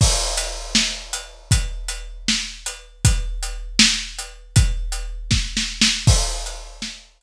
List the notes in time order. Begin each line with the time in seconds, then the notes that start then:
0.01 kick, crash
0.37 closed hi-hat
0.75 snare
1.13 closed hi-hat
1.51 kick, closed hi-hat
1.88 closed hi-hat
2.28 snare
2.66 closed hi-hat
3.05 kick, closed hi-hat
3.43 closed hi-hat
3.79 snare
4.19 closed hi-hat
4.56 kick, closed hi-hat
4.92 closed hi-hat
5.31 kick, snare
5.57 snare
5.81 snare
6.07 kick, crash
6.46 closed hi-hat
6.82 snare
7.21 closed hi-hat